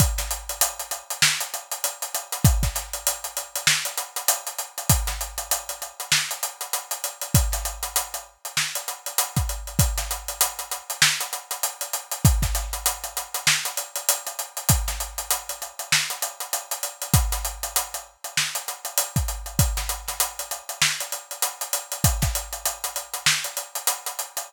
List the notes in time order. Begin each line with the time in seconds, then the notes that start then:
0.00 kick, closed hi-hat
0.18 snare, closed hi-hat
0.31 closed hi-hat
0.49 closed hi-hat
0.61 closed hi-hat
0.79 closed hi-hat
0.91 closed hi-hat
1.10 closed hi-hat
1.22 snare
1.40 closed hi-hat
1.54 closed hi-hat
1.71 closed hi-hat
1.84 closed hi-hat
2.02 closed hi-hat
2.15 closed hi-hat
2.32 closed hi-hat
2.45 kick, closed hi-hat
2.63 kick, snare, closed hi-hat
2.75 snare, closed hi-hat
2.93 closed hi-hat
3.07 closed hi-hat
3.24 closed hi-hat
3.37 closed hi-hat
3.55 closed hi-hat
3.67 snare
3.85 closed hi-hat
3.97 closed hi-hat
4.16 closed hi-hat
4.28 closed hi-hat
4.47 closed hi-hat
4.58 closed hi-hat
4.78 closed hi-hat
4.89 kick, closed hi-hat
5.07 snare, closed hi-hat
5.21 closed hi-hat
5.38 closed hi-hat
5.51 closed hi-hat
5.69 closed hi-hat
5.82 closed hi-hat
6.00 closed hi-hat
6.12 snare
6.31 closed hi-hat
6.43 closed hi-hat
6.61 closed hi-hat
6.73 closed hi-hat
6.91 closed hi-hat
7.04 closed hi-hat
7.21 closed hi-hat
7.34 kick, closed hi-hat
7.52 snare, closed hi-hat
7.65 closed hi-hat
7.83 closed hi-hat
7.96 closed hi-hat
8.14 closed hi-hat
8.45 closed hi-hat
8.57 snare
8.75 closed hi-hat
8.88 closed hi-hat
9.06 closed hi-hat
9.18 closed hi-hat
9.36 kick, closed hi-hat
9.49 closed hi-hat
9.67 closed hi-hat
9.79 kick, closed hi-hat
9.98 snare, closed hi-hat
10.11 closed hi-hat
10.28 closed hi-hat
10.41 closed hi-hat
10.59 closed hi-hat
10.71 closed hi-hat
10.90 closed hi-hat
11.02 snare
11.21 closed hi-hat
11.33 closed hi-hat
11.51 closed hi-hat
11.63 closed hi-hat
11.81 closed hi-hat
11.93 closed hi-hat
12.11 closed hi-hat
12.25 kick, closed hi-hat
12.42 kick, snare, closed hi-hat
12.55 snare, closed hi-hat
12.73 closed hi-hat
12.86 closed hi-hat
13.04 closed hi-hat
13.17 closed hi-hat
13.34 closed hi-hat
13.47 snare
13.65 closed hi-hat
13.77 closed hi-hat
13.96 closed hi-hat
14.09 closed hi-hat
14.27 closed hi-hat
14.39 closed hi-hat
14.57 closed hi-hat
14.69 kick, closed hi-hat
14.88 snare, closed hi-hat
15.00 closed hi-hat
15.18 closed hi-hat
15.30 closed hi-hat
15.49 closed hi-hat
15.62 closed hi-hat
15.79 closed hi-hat
15.92 snare
16.10 closed hi-hat
16.22 closed hi-hat
16.40 closed hi-hat
16.53 closed hi-hat
16.71 closed hi-hat
16.83 closed hi-hat
17.02 closed hi-hat
17.14 kick, closed hi-hat
17.32 snare, closed hi-hat
17.45 closed hi-hat
17.63 closed hi-hat
17.76 closed hi-hat
17.94 closed hi-hat
18.24 closed hi-hat
18.37 snare
18.55 closed hi-hat
18.68 closed hi-hat
18.85 closed hi-hat
18.98 closed hi-hat
19.16 kick, closed hi-hat
19.28 closed hi-hat
19.46 closed hi-hat
19.59 kick, closed hi-hat
19.77 snare, closed hi-hat
19.89 closed hi-hat
20.08 snare, closed hi-hat
20.20 closed hi-hat
20.39 closed hi-hat
20.51 closed hi-hat
20.69 closed hi-hat
20.82 snare
21.00 closed hi-hat
21.12 closed hi-hat
21.31 closed hi-hat
21.42 closed hi-hat
21.61 closed hi-hat
21.73 closed hi-hat
21.92 closed hi-hat
22.04 kick, closed hi-hat
22.22 kick, snare, closed hi-hat
22.35 closed hi-hat
22.53 closed hi-hat
22.65 closed hi-hat
22.84 closed hi-hat
22.96 closed hi-hat
23.14 closed hi-hat
23.26 snare
23.44 closed hi-hat
23.57 closed hi-hat
23.75 closed hi-hat
23.87 closed hi-hat
24.06 closed hi-hat
24.19 closed hi-hat
24.37 closed hi-hat